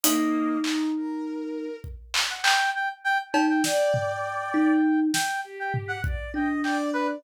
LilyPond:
<<
  \new Staff \with { instrumentName = "Brass Section" } { \time 6/8 \tempo 4. = 67 dis''4 r2 | r8. fis''16 g''8 g''16 r16 g''16 r16 g''16 g''16 | g''2~ g''8 g''8 | r16 g''16 r16 fis''16 r8 g''16 r16 g''16 r16 b'16 r16 | }
  \new Staff \with { instrumentName = "Kalimba" } { \time 6/8 dis'2. | r2 r8 dis'8 | r4. dis'4 r8 | r4. d'4. | }
  \new Staff \with { instrumentName = "Violin" } { \time 6/8 ais4 dis'8 ais'4. | r2. | d''2 r4 | g'4 d''8 dis''8 d''8 d''8 | }
  \new DrumStaff \with { instrumentName = "Drums" } \drummode { \time 6/8 hh4 hc8 r4. | bd8 hc8 hc8 r4 cb8 | sn8 tomfh4 r4 sn8 | r8 tomfh8 bd8 r8 hc4 | }
>>